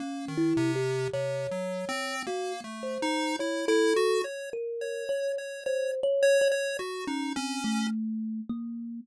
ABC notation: X:1
M:4/4
L:1/16
Q:1/4=53
K:none
V:1 name="Kalimba"
(3^C2 E2 G2 ^c4 ^F z =c2 ^c A2 z | ^A2 ^c2 (3=c2 ^c2 c2 ^F ^C =C =A,3 ^A,2 |]
V:2 name="Lead 1 (square)"
^A, ^D, C,2 (3C,2 ^F,2 C2 (3A,2 =A,2 ^D2 E E ^F ^c | z ^c2 c c z c c ^F ^D ^C2 z4 |]